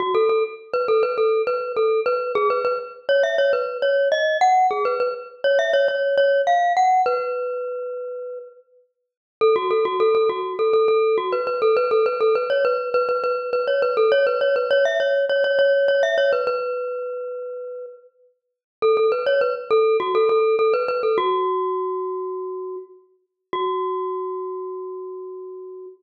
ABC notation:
X:1
M:4/4
L:1/16
Q:1/4=102
K:F#m
V:1 name="Glockenspiel"
F A A z2 B A B A2 B2 A2 B2 | G B B z2 c e c B2 c2 ^d2 f2 | G B B z2 c e c c2 c2 ^e2 f2 | B10 z6 |
A F A F A A F2 A A A2 F B B A | B A B A B c B2 B B B2 B c B A | c B c B c e c2 c c c2 c e c B | B10 z6 |
A A B c B z A2 F A A2 A B B A | F12 z4 | F16 |]